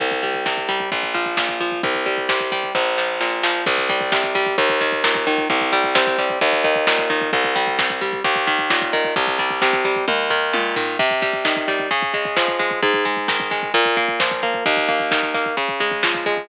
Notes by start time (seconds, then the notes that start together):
0.00 C2, kick, closed hi-hat
0.11 kick
0.23 G3, kick, closed hi-hat
0.34 kick
0.46 C3, kick, snare
0.57 kick
0.69 G3, kick, snare, closed hi-hat
0.80 kick
0.92 A#1, kick, closed hi-hat
1.03 kick
1.14 F3, kick, closed hi-hat
1.26 kick
1.37 A#2, kick, snare
1.49 kick
1.60 F3, kick, closed hi-hat
1.72 kick
1.83 C2, kick, closed hi-hat
1.95 kick
2.06 G3, kick, closed hi-hat
2.18 kick
2.29 C3, kick, snare
2.40 kick
2.52 G3, kick, snare, closed hi-hat
2.63 kick
2.75 A#1, kick, snare
2.98 F3, snare
3.21 A#2, snare
3.43 F3, snare
3.66 C2, kick, crash
3.78 kick
3.89 G3, kick, closed hi-hat
4.01 kick
4.12 C3, kick, snare
4.24 kick
4.35 G3, kick, snare, closed hi-hat
4.46 kick
4.58 D#2, kick, closed hi-hat
4.69 kick
4.81 D#3, kick, closed hi-hat
4.92 kick
5.04 A#2, kick, snare
5.15 kick
5.27 D#3, kick, closed hi-hat
5.38 kick
5.50 C2, kick, closed hi-hat
5.61 kick
5.72 G3, kick, closed hi-hat
5.84 kick
5.95 C3, kick, snare
6.07 kick
6.18 G3, kick, snare, closed hi-hat
6.30 kick
6.41 D#2, kick, closed hi-hat
6.53 kick
6.64 D#3, kick, closed hi-hat
6.75 kick
6.87 A#2, kick, snare
6.98 kick
7.10 D#3, kick, closed hi-hat
7.21 kick
7.33 C2, kick, closed hi-hat
7.44 kick
7.56 G3, kick, closed hi-hat
7.67 kick
7.79 C3, kick, snare
7.90 kick
8.01 G3, kick, snare, closed hi-hat
8.13 kick
8.24 D#2, kick, closed hi-hat
8.36 kick
8.47 D#3, kick, closed hi-hat
8.59 kick
8.70 A#2, kick, snare
8.82 kick
8.93 D#3, kick, closed hi-hat
9.05 kick
9.16 C2, kick, closed hi-hat
9.27 kick
9.39 G3, kick, closed hi-hat
9.50 kick
9.62 C3, kick, snare
9.73 kick
9.85 G3, kick, snare, closed hi-hat
9.96 kick
10.08 D#2, kick, high tom
10.30 D#3, floor tom
10.53 A#2, high tom
10.76 D#3, floor tom
10.99 C3, kick, crash
11.11 kick
11.22 G3, kick, closed hi-hat
11.33 kick
11.45 D#3, kick, snare
11.56 kick
11.68 G3, kick, snare, closed hi-hat
11.79 kick
11.91 C#3, kick, closed hi-hat
12.02 kick
12.14 G#3, kick, closed hi-hat
12.25 kick
12.36 F3, kick, snare
12.48 kick
12.59 G#3, kick, closed hi-hat
12.71 kick
12.82 G#2, kick, closed hi-hat
12.94 kick
13.05 G#3, kick, closed hi-hat
13.17 kick
13.28 D#3, kick, snare
13.40 kick
13.51 G#3, kick, snare, closed hi-hat
13.63 kick
13.74 A#2, kick, closed hi-hat
13.85 kick
13.97 A#3, kick, closed hi-hat
14.08 kick
14.20 F3, kick, snare
14.31 kick
14.43 A#3, kick, closed hi-hat
14.54 kick
14.66 D#2, kick, closed hi-hat
14.77 kick
14.89 A#3, kick, closed hi-hat
15.00 kick
15.11 D#3, kick, snare
15.23 kick
15.34 A#3, kick, snare, closed hi-hat
15.46 kick
15.57 C#3, kick, closed hi-hat
15.69 kick
15.80 G#3, kick, closed hi-hat
15.91 kick
16.03 F3, kick, snare
16.15 kick
16.26 G#3, kick, closed hi-hat
16.37 kick